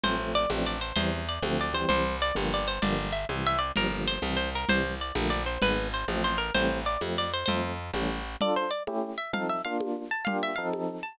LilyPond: <<
  \new Staff \with { instrumentName = "Acoustic Guitar (steel)" } { \time 6/8 \key d \minor \tempo 4. = 129 c''4 d''8 r8 d''8 c''8 | c''4 d''8 r8 d''8 c''8 | c''4 d''8 r8 d''8 c''8 | d''4 e''8 r8 e''8 d''8 |
bes'4 c''8 r8 c''8 bes'8 | c''4 d''8 r8 d''8 c''8 | b'4 c''8 r8 c''8 bes'8 | c''4 d''8 r8 d''8 c''8 |
c''4 r2 | d''8 c''8 d''8 r4 e''8 | f''8 e''8 f''8 r4 a''8 | f''8 e''8 f''8 r4 a''8 | }
  \new Staff \with { instrumentName = "Electric Piano 1" } { \time 6/8 \key d \minor <f a c'>8 <f a c'>4 <f a c' d'>4. | <e g c'>4. <d f a c'>4 <e g c'>8~ | <e g c'>4. <d f g bes>4. | <d f g bes>4. <c e g>4. |
<d f g bes>8 <d f g bes>4 <c e g>4. | <c e g>4. <d f a bes>4. | <dis gis b>4. <f a c'>4. | <e g a c'>4. <f a c'>4. |
<f a c'>4. <e g a cis'>4. | <d' f' a'>4. <a cis' e' g'>4. | <f c' ees' a'>4 <bes d' f'>2 | <bes d' f' g'>4 <f c' ees' a'>2 | }
  \new Staff \with { instrumentName = "Electric Bass (finger)" } { \clef bass \time 6/8 \key d \minor a,,4. a,,4. | e,4. d,4. | c,4. g,,4. | g,,4. c,4. |
g,,4. c,4. | c,4. bes,,4. | gis,,4. a,,4. | a,,4. f,4. |
f,4. a,,4. | r2. | r2. | r2. | }
  \new DrumStaff \with { instrumentName = "Drums" } \drummode { \time 6/8 cgl4. cgho4. | cgl4. cgho4. | cgl4. cgho4. | cgl4. cgho4. |
cgl4. cgho4. | cgl4. cgho4. | cgl4. cgho4. | cgl4. cgho4. |
cgl4. cgho4. | cgl4. cgho4. | cgl4. cgho4. | cgl4. cgho4. | }
>>